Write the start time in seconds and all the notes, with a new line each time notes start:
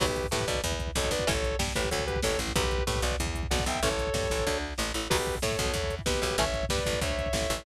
0.00 B1 F#3 B3 G4 B4, kick, crash
0.08 kick
0.16 kick, closed hi-hat
0.24 kick
0.31 A2 A3 G4 B4, kick, snare
0.40 kick
0.47 B1 B2 B4 D5, kick, closed hi-hat
0.55 kick
0.64 E2 E3, kick, closed hi-hat
0.72 kick
0.79 kick, closed hi-hat
0.87 kick
0.95 B1 B2 A4 C#5, kick, snare
1.04 kick
1.11 B1 B2 B4 D5, kick, closed hi-hat
1.19 kick
1.27 A1 E3 A3 C#4 A4 C#5, kick, closed hi-hat
1.35 kick
1.43 kick, closed hi-hat
1.51 kick
1.59 G2 G3, kick, snare
1.68 kick
1.75 A1 A2 G4 B4, kick, closed hi-hat
1.84 kick
1.91 D2 D3 A4 C#5, kick, closed hi-hat
1.99 kick
2.07 G4 B4, kick, closed hi-hat
2.16 kick
2.22 A1 A2 A4 C#5, kick, snare
2.31 kick
2.38 A1 A2, kick, closed hi-hat
2.47 kick
2.56 B1 F#3 B3 G4 B4, kick, closed hi-hat
2.64 kick
2.71 kick, closed hi-hat
2.78 kick
2.87 A2 A3 G4 B4, kick, snare
2.96 kick
3.02 B1 B2 B4 D5, kick, closed hi-hat
3.11 kick
3.20 E2 E3, kick, closed hi-hat
3.26 kick
3.35 kick, closed hi-hat
3.43 kick
3.51 B1 B2 D5 F#5, kick, snare
3.59 kick
3.66 B1 B2 E5 G5, kick, closed hi-hat
3.74 kick
3.83 A1 E3 A3 C#4 A4 C#5, kick, closed hi-hat
3.91 kick
3.98 kick, closed hi-hat
4.07 kick
4.14 G2 G3, kick, snare
4.23 kick
4.30 A1 A2, kick, closed hi-hat
4.39 kick
4.47 D2 D3, kick, snare
4.78 A1 A2, snare
4.94 A1 A2
5.10 B1 F#3 B3 G4 B4, kick, crash
5.18 kick
5.26 kick, closed hi-hat
5.35 kick
5.42 A2 A3 A4 C#5, kick, snare
5.51 kick
5.59 B1 B2, kick, closed hi-hat
5.65 kick
5.74 E2 E3, kick, closed hi-hat
5.84 kick
5.90 kick, closed hi-hat
5.99 kick
6.06 B1 B2 G4 B4, kick, snare
6.14 kick
6.22 B1 B2, kick, closed hi-hat
6.31 kick
6.38 A1 E3 A3 C#4 C#5 E5, kick, closed hi-hat
6.46 kick
6.54 kick, closed hi-hat
6.63 kick
6.69 G2 G3 B4 D5, kick, snare
6.78 kick
6.86 A1 A2, kick, closed hi-hat
6.93 kick
7.01 D2 D3 C#5 E5, kick, closed hi-hat
7.10 kick
7.18 kick, closed hi-hat
7.26 kick
7.33 A1 A2, kick, snare
7.41 kick
7.50 A1 A2, kick, closed hi-hat
7.58 kick